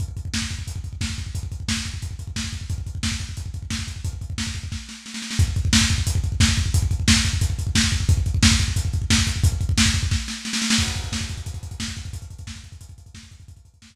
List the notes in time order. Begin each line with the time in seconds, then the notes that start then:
0.00 kick, closed hi-hat
0.08 kick
0.17 kick, closed hi-hat
0.25 kick
0.34 kick, snare
0.42 kick
0.50 kick, closed hi-hat
0.59 kick
0.67 kick, closed hi-hat
0.76 kick
0.84 kick, closed hi-hat
0.93 kick
1.01 kick, snare
1.10 kick
1.18 kick, closed hi-hat
1.26 kick
1.35 kick, closed hi-hat
1.43 kick
1.52 kick, closed hi-hat
1.60 kick
1.68 kick, snare
1.77 kick
1.85 kick, closed hi-hat
1.94 kick
2.02 kick, closed hi-hat
2.11 kick
2.19 kick, closed hi-hat
2.27 kick
2.36 kick, snare
2.44 kick
2.53 kick, closed hi-hat
2.61 kick
2.70 kick, closed hi-hat
2.78 kick
2.86 kick, closed hi-hat
2.95 kick
3.03 kick, snare
3.12 kick
3.20 kick, closed hi-hat
3.29 kick
3.37 kick, closed hi-hat
3.46 kick
3.54 kick, closed hi-hat
3.62 kick
3.70 kick, snare
3.79 kick
3.88 kick, closed hi-hat
3.96 kick
4.04 kick, closed hi-hat
4.13 kick
4.21 kick, closed hi-hat
4.30 kick
4.38 kick, snare
4.47 kick
4.55 kick, closed hi-hat
4.63 kick
4.72 kick, snare
4.89 snare
5.06 snare
5.14 snare
5.22 snare
5.31 snare
5.39 kick, closed hi-hat
5.48 kick
5.56 kick, closed hi-hat
5.65 kick
5.73 kick, snare
5.81 kick
5.90 kick, closed hi-hat
5.98 kick
6.07 kick, closed hi-hat
6.15 kick
6.24 kick, closed hi-hat
6.32 kick
6.40 kick, snare
6.49 kick
6.57 kick, closed hi-hat
6.66 kick
6.74 kick, closed hi-hat
6.82 kick
6.91 kick, closed hi-hat
7.00 kick
7.08 kick, snare
7.16 kick
7.25 kick, closed hi-hat
7.33 kick
7.41 kick, closed hi-hat
7.50 kick
7.59 kick, closed hi-hat
7.67 kick
7.75 kick, snare
7.84 kick
7.92 kick, closed hi-hat
8.00 kick
8.09 kick, closed hi-hat
8.17 kick
8.26 kick, closed hi-hat
8.34 kick
8.43 kick, snare
8.51 kick
8.60 kick, closed hi-hat
8.68 kick
8.76 kick, closed hi-hat
8.85 kick
8.93 kick, closed hi-hat
9.02 kick
9.10 kick, snare
9.18 kick
9.27 kick, closed hi-hat
9.36 kick
9.44 kick, closed hi-hat
9.52 kick
9.61 kick, closed hi-hat
9.69 kick
9.78 kick, snare
9.86 kick
9.94 kick, closed hi-hat
10.03 kick
10.11 kick, snare
10.28 snare
10.45 snare
10.53 snare
10.62 snare
10.70 snare
10.78 kick, crash
10.87 kick, closed hi-hat
10.95 kick, closed hi-hat
11.04 kick, closed hi-hat
11.12 kick, snare
11.21 kick, closed hi-hat
11.29 kick, closed hi-hat
11.37 kick, closed hi-hat
11.46 kick, closed hi-hat
11.54 kick, closed hi-hat
11.63 kick, closed hi-hat
11.71 kick, closed hi-hat
11.80 kick, snare
11.88 kick, closed hi-hat
11.97 kick, closed hi-hat
12.05 kick, closed hi-hat
12.13 kick, closed hi-hat
12.22 kick, closed hi-hat
12.30 kick, closed hi-hat
12.39 kick, closed hi-hat
12.47 kick, snare
12.56 kick, closed hi-hat
12.64 kick, closed hi-hat
12.72 kick, closed hi-hat
12.81 kick, closed hi-hat
12.89 kick, closed hi-hat
12.98 kick, closed hi-hat
13.06 kick, closed hi-hat
13.14 kick, snare
13.23 kick, closed hi-hat
13.31 kick, closed hi-hat
13.40 kick, closed hi-hat
13.48 kick, closed hi-hat
13.57 kick, closed hi-hat
13.65 kick, closed hi-hat
13.74 kick, closed hi-hat
13.82 kick, snare
13.90 kick, closed hi-hat